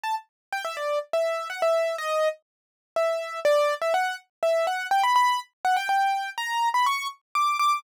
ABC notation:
X:1
M:3/4
L:1/16
Q:1/4=123
K:Em
V:1 name="Acoustic Grand Piano"
a z3 | g e d2 z e3 f e3 | ^d3 z5 e4 | [K:Bm] d3 e f2 z2 e2 f2 |
g b b2 z2 f g g4 | ^a3 b c'2 z2 d'2 d'2 |]